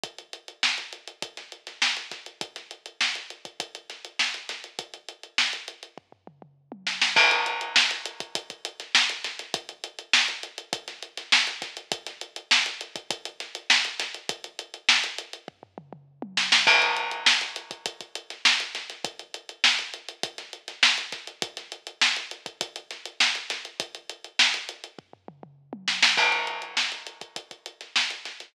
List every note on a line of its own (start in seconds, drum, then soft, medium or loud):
0.04 kick loud
0.04 closed hi-hat loud
0.18 closed hi-hat medium
0.33 closed hi-hat medium
0.48 closed hi-hat medium
0.63 snare loud
0.78 closed hi-hat medium
0.93 closed hi-hat medium
1.08 closed hi-hat medium
1.22 kick loud
1.22 closed hi-hat loud
1.37 snare soft
1.37 closed hi-hat medium
1.52 closed hi-hat medium
1.67 snare soft
1.67 closed hi-hat medium
1.82 snare loud
1.97 closed hi-hat medium
2.12 kick medium
2.12 snare medium
2.12 closed hi-hat medium
2.26 closed hi-hat medium
2.41 kick loud
2.41 closed hi-hat loud
2.56 snare soft
2.56 closed hi-hat medium
2.71 closed hi-hat medium
2.86 closed hi-hat medium
3.01 snare loud
3.15 closed hi-hat medium
3.30 closed hi-hat medium
3.45 kick medium
3.45 closed hi-hat medium
3.60 kick loud
3.60 closed hi-hat loud
3.75 closed hi-hat medium
3.90 snare soft
3.90 closed hi-hat medium
4.05 closed hi-hat medium
4.19 snare loud
4.34 closed hi-hat medium
4.49 snare medium
4.49 closed hi-hat loud
4.64 closed hi-hat medium
4.79 kick loud
4.79 closed hi-hat loud
4.94 closed hi-hat medium
5.09 closed hi-hat medium
5.23 closed hi-hat medium
5.38 snare loud
5.53 closed hi-hat medium
5.68 closed hi-hat medium
5.83 closed hi-hat medium
5.98 kick medium
5.98 floor tom medium
6.12 floor tom loud
6.27 mid tom loud
6.42 mid tom medium
6.72 high tom loud
6.87 snare loud
7.02 snare loud
7.16 kick loud
7.16 crash loud
7.31 closed hi-hat loud
7.46 closed hi-hat loud
7.61 closed hi-hat loud
7.76 snare loud
7.91 snare soft
7.91 closed hi-hat loud
8.06 closed hi-hat loud
8.20 kick loud
8.20 closed hi-hat loud
8.35 kick loud
8.35 closed hi-hat loud
8.50 kick medium
8.50 closed hi-hat medium
8.65 closed hi-hat loud
8.80 snare soft
8.80 closed hi-hat medium
8.95 snare loud
9.10 closed hi-hat loud
9.24 snare medium
9.24 closed hi-hat loud
9.39 snare soft
9.39 closed hi-hat medium
9.54 kick loud
9.54 closed hi-hat loud
9.69 closed hi-hat medium
9.84 closed hi-hat loud
9.99 closed hi-hat medium
10.13 snare loud
10.28 closed hi-hat medium
10.43 closed hi-hat loud
10.58 closed hi-hat loud
10.73 kick loud
10.73 closed hi-hat loud
10.88 snare medium
10.88 closed hi-hat medium
11.03 closed hi-hat medium
11.17 snare medium
11.17 closed hi-hat loud
11.32 snare loud
11.47 closed hi-hat medium
11.62 kick loud
11.62 snare medium
11.62 closed hi-hat loud
11.77 closed hi-hat medium
11.92 kick loud
11.92 closed hi-hat loud
12.07 snare soft
12.07 closed hi-hat loud
12.21 closed hi-hat loud
12.36 closed hi-hat loud
12.51 snare loud
12.66 closed hi-hat loud
12.81 closed hi-hat loud
12.96 kick loud
12.96 closed hi-hat loud
13.11 kick loud
13.11 closed hi-hat loud
13.25 closed hi-hat loud
13.40 snare medium
13.40 closed hi-hat loud
13.55 closed hi-hat loud
13.70 snare loud
13.85 closed hi-hat medium
14.00 snare medium
14.00 closed hi-hat loud
14.14 closed hi-hat medium
14.29 kick loud
14.29 closed hi-hat loud
14.44 closed hi-hat medium
14.59 closed hi-hat loud
14.74 closed hi-hat medium
14.89 snare loud
15.04 closed hi-hat loud
15.18 closed hi-hat loud
15.33 closed hi-hat medium
15.48 kick loud
15.48 floor tom loud
15.63 floor tom loud
15.78 mid tom loud
15.93 mid tom loud
16.22 high tom loud
16.37 snare loud
16.52 snare loud
16.67 kick loud
16.67 crash loud
16.82 closed hi-hat medium
16.97 closed hi-hat loud
17.12 closed hi-hat medium
17.26 snare loud
17.41 snare soft
17.41 closed hi-hat medium
17.56 closed hi-hat loud
17.71 kick loud
17.71 closed hi-hat loud
17.86 kick loud
17.86 closed hi-hat loud
18.01 kick medium
18.01 closed hi-hat medium
18.15 closed hi-hat loud
18.30 snare soft
18.30 closed hi-hat medium
18.45 snare loud
18.60 closed hi-hat loud
18.75 snare medium
18.75 closed hi-hat medium
18.90 snare soft
18.90 closed hi-hat medium
19.05 kick loud
19.05 closed hi-hat loud
19.19 closed hi-hat medium
19.34 closed hi-hat loud
19.49 closed hi-hat medium
19.64 snare loud
19.79 closed hi-hat medium
19.94 closed hi-hat medium
20.09 closed hi-hat loud
20.23 kick loud
20.23 closed hi-hat loud
20.38 snare medium
20.38 closed hi-hat medium
20.53 closed hi-hat medium
20.68 snare soft
20.68 closed hi-hat medium
20.83 snare loud
20.98 closed hi-hat medium
21.12 kick medium
21.12 snare medium
21.12 closed hi-hat loud
21.27 closed hi-hat medium
21.42 kick loud
21.42 closed hi-hat loud
21.57 snare soft
21.57 closed hi-hat medium
21.72 closed hi-hat loud
21.87 closed hi-hat medium
22.02 snare loud
22.16 closed hi-hat medium
22.31 closed hi-hat medium
22.46 kick loud
22.46 closed hi-hat loud
22.61 kick loud
22.61 closed hi-hat loud
22.76 closed hi-hat loud
22.91 snare medium
22.91 closed hi-hat medium
23.06 closed hi-hat loud
23.20 snare loud
23.35 closed hi-hat medium
23.50 snare medium
23.50 closed hi-hat loud
23.65 closed hi-hat medium
23.80 kick loud
23.80 closed hi-hat loud
23.95 closed hi-hat medium
24.10 closed hi-hat loud
24.24 closed hi-hat medium
24.39 snare loud
24.54 closed hi-hat medium
24.69 closed hi-hat loud
24.84 closed hi-hat medium
24.99 kick loud
24.99 floor tom loud
25.13 floor tom loud
25.28 mid tom loud
25.43 mid tom loud
25.73 high tom loud
25.88 snare loud
26.03 snare loud
26.17 kick loud
26.17 crash loud
26.32 closed hi-hat medium
26.47 closed hi-hat medium
26.62 closed hi-hat medium
26.77 snare loud
26.92 snare soft
26.92 closed hi-hat medium
27.07 closed hi-hat medium
27.21 kick medium
27.21 closed hi-hat medium
27.36 kick medium
27.36 closed hi-hat loud
27.51 kick medium
27.51 closed hi-hat medium
27.66 closed hi-hat medium
27.81 snare soft
27.81 closed hi-hat medium
27.96 snare loud
28.11 closed hi-hat medium
28.25 snare medium
28.25 closed hi-hat medium
28.40 snare soft
28.40 closed hi-hat medium